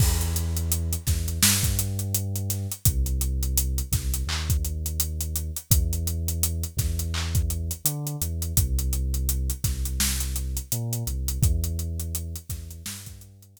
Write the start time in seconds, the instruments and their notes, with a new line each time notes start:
0.00 synth bass 2 E2, kick, crash
0.21 closed hi-hat
0.36 closed hi-hat
0.57 closed hi-hat
0.72 closed hi-hat
0.93 closed hi-hat
1.07 synth bass 2 E2, kick, snare, closed hi-hat
1.28 closed hi-hat
1.43 synth bass 2 G2, snare
1.63 kick, closed hi-hat
1.79 closed hi-hat
1.99 closed hi-hat
2.15 closed hi-hat
2.36 closed hi-hat
2.50 snare, closed hi-hat
2.72 closed hi-hat
2.85 synth bass 2 C2, kick, closed hi-hat
3.06 closed hi-hat
3.21 closed hi-hat
3.43 closed hi-hat
3.57 closed hi-hat
3.78 closed hi-hat
3.92 synth bass 2 C2, kick, snare, closed hi-hat
4.14 closed hi-hat
4.27 synth bass 2 D#2, clap
4.50 kick, closed hi-hat
4.65 closed hi-hat
4.86 closed hi-hat
5.00 closed hi-hat
5.21 closed hi-hat
5.36 closed hi-hat
5.56 closed hi-hat
5.70 synth bass 2 E2, kick, closed hi-hat
5.93 closed hi-hat
6.07 closed hi-hat
6.28 closed hi-hat
6.43 closed hi-hat
6.63 closed hi-hat
6.77 synth bass 2 E2, kick, snare, closed hi-hat
6.99 closed hi-hat
7.14 clap
7.35 kick, closed hi-hat
7.50 closed hi-hat
7.71 closed hi-hat
7.85 synth bass 2 D3, closed hi-hat
8.07 closed hi-hat
8.21 synth bass 2 E2, closed hi-hat
8.42 closed hi-hat
8.57 synth bass 2 C2, kick, closed hi-hat
8.79 closed hi-hat
8.93 closed hi-hat
9.14 closed hi-hat
9.29 closed hi-hat
9.50 closed hi-hat
9.64 synth bass 2 C2, kick, snare, closed hi-hat
9.85 closed hi-hat
10.00 snare
10.20 closed hi-hat
10.36 closed hi-hat
10.57 closed hi-hat
10.72 synth bass 2 A#2, closed hi-hat
10.93 closed hi-hat
11.07 synth bass 2 C2, closed hi-hat
11.28 closed hi-hat
11.42 synth bass 2 E2, kick, closed hi-hat
11.64 closed hi-hat
11.79 closed hi-hat
12.00 closed hi-hat
12.15 closed hi-hat
12.36 closed hi-hat
12.50 synth bass 2 E2, kick, snare, closed hi-hat
12.71 closed hi-hat
12.86 synth bass 2 G2, snare
13.06 kick, closed hi-hat
13.21 closed hi-hat
13.42 closed hi-hat
13.57 closed hi-hat